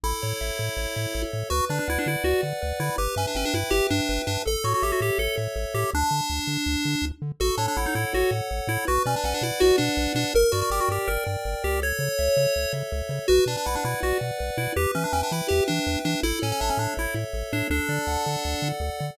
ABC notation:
X:1
M:4/4
L:1/16
Q:1/4=163
K:D
V:1 name="Lead 1 (square)"
E14 z2 | F2 D D E D E2 F2 z4 E2 | G2 C D C D E2 G2 D4 D2 | A2 F F G F G2 A2 z4 G2 |
D14 z2 | F2 D D E ^D E2 F2 z4 E2 | F2 C D C D E2 F2 D4 D2 | _B2 F F G F G2 B2 z4 G2 |
c10 z6 | F2 D D E D E2 F2 z4 E2 | G2 C D C D E2 G2 D4 D2 | E2 C C D C D2 E2 z4 D2 |
D12 z4 |]
V:2 name="Lead 1 (square)"
A2 c2 e2 A2 c2 e2 A2 c2 | B2 d2 f2 B2 d2 f2 B2 d2 | B2 e2 g2 B2 e2 g2 B2 e2 | A2 c2 e2 A2 c2 e2 A2 c2 |
z16 | A2 c2 f2 A2 c2 f2 A2 c2 | B2 d2 f2 B2 d2 f2 B2 d2 | _B2 d2 g2 B2 d2 g2 B2 d2 |
A2 c2 e2 A2 c2 e2 A2 c2 | B2 d2 f2 B2 d2 f2 B2 d2 | B2 e2 g2 B2 e2 g2 B2 e2 | A2 c2 e2 A2 c2 e2 A2 c2 |
A2 d2 f2 A2 d2 f2 A2 d2 |]
V:3 name="Synth Bass 1" clef=bass
A,,,2 A,,2 A,,,2 A,,2 A,,,2 A,,2 A,,,2 A,,2 | D,,2 D,2 D,,2 D,2 D,,2 D,2 D,,2 D,2 | G,,,2 G,,2 G,,,2 G,,2 G,,,2 G,,2 G,,,2 G,,2 | A,,,2 A,,2 A,,,2 A,,2 A,,,2 A,,2 A,,,2 A,,2 |
D,,2 D,2 D,,2 D,2 D,,2 D,2 D,,2 D,2 | A,,,2 A,,2 A,,,2 A,,2 A,,,2 A,,2 A,,,2 A,,2 | B,,,2 B,,2 B,,,2 B,,2 B,,,2 B,,2 B,,,2 B,,2 | G,,,2 G,,2 G,,,2 G,,2 G,,,2 G,,2 G,,,2 C,,2- |
C,,2 C,2 C,,2 C,2 C,,2 C,2 C,,2 C,2 | B,,,2 B,,2 B,,,2 B,,2 B,,,2 B,,2 B,,,2 B,,2 | E,,2 E,2 E,,2 E,2 E,,2 E,2 E,,2 E,2 | A,,,2 A,,2 A,,,2 A,,2 A,,,2 A,,2 A,,,2 A,,2 |
D,,2 D,2 D,,2 D,2 D,,2 D,2 D,,2 D,2 |]